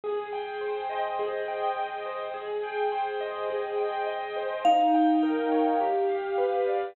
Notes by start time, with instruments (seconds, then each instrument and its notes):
0.04 acoustic grand piano G#4
0.33 acoustic grand piano G5
0.61 acoustic grand piano C5
0.90 acoustic grand piano D#5
1.19 acoustic grand piano G#4
1.48 acoustic grand piano G5
1.77 acoustic grand piano D#5
2.06 acoustic grand piano C5
2.34 acoustic grand piano G#4
2.63 acoustic grand piano G5
2.92 acoustic grand piano C5
3.21 acoustic grand piano D#5
3.50 acoustic grand piano G#4
3.78 acoustic grand piano G5
4.07 acoustic grand piano D#5
4.36 acoustic grand piano C5
4.65 acoustic grand piano D#4, vibraphone F5
4.94 acoustic grand piano G5
5.23 acoustic grand piano A#4
5.52 acoustic grand piano C#5
5.81 acoustic grand piano G4
6.09 acoustic grand piano F5
6.38 acoustic grand piano B4
6.67 acoustic grand piano D5